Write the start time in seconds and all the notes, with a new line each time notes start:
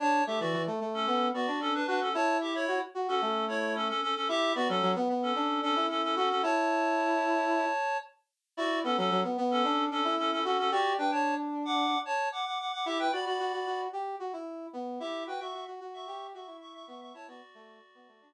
0.00 D4 C#5 A5
0.27 A3 G4 E5
0.40 E3 F#4 D5
0.53 E3
0.67 A3
0.80 A3
0.94 C#4 A4
1.07 B3
1.34 B3 F#4 D5
1.47 D4
1.61 C#4 A4
1.74 D4 B4
1.87 D4 F#4 B4
2.01 C#4 A4
2.14 E4 C#5 A5
2.41 G4 E5
2.54 E4 C#5
2.68 F#4
2.95 F#4
3.08 C#4 F#4 A4
3.21 A3
3.48 E4 C#5
3.75 C#4 A4
3.88 C#4 A4
4.02 C#4 A4
4.15 C#4 A4
4.28 E4 G4 E5
4.55 B3 F#4 D5
4.69 F#3 C#4 A4
4.82 F#3
4.96 B3
5.09 B3
5.22 C#4 A4
5.36 D4
5.62 C#4 D4 A4
5.76 E4
5.89 C#4 A4
6.03 C#4 A4
6.16 C#4 F#4 A4
6.29 C#4 A4
6.43 E4 C#5 A5
8.57 E4 F#4 D5
8.84 B3 C#4 A4
8.97 F#3 C#4 A4
9.11 F#3
9.24 B3
9.37 B3
9.51 C#4 A4
9.64 D4
9.91 C#4 D4 A4
10.04 E4
10.18 C#4 A4
10.31 C#4 A4
10.44 C#4 F#4 A4
10.58 C#4 A4
10.71 F#4 G4 D5
10.98 D4 B4 G5
11.12 C#5 A5
11.65 F#5 D6
12.05 C#5 A5
12.32 F#5 D6
12.46 F#5 D6
12.59 F#5 D6
12.72 F#5 D6
12.86 E4 G4 E5
12.99 B4 G5
13.12 F#4 D5 B5
13.26 F#4 D5 B5
13.39 F#4
13.53 F#4
13.66 F#4
13.93 G4
14.20 F#4
14.33 E4
14.73 B3
15.00 E4 G4 E5
15.27 F#4 B4 G5
15.40 F#4 E5 C#6
15.54 F#4
15.67 F#4
15.80 F#4
15.94 E5 C#6
16.07 G4
16.34 F#4 E5 C#6
16.47 E4
16.61 E5 C#6
16.74 E5 C#6
16.87 B3 E5 C#6
17.01 E5 C#6
17.14 E4 C#5 A5
17.28 B3 F#4 D5
17.54 A3
17.95 B3
18.08 A3
18.21 D4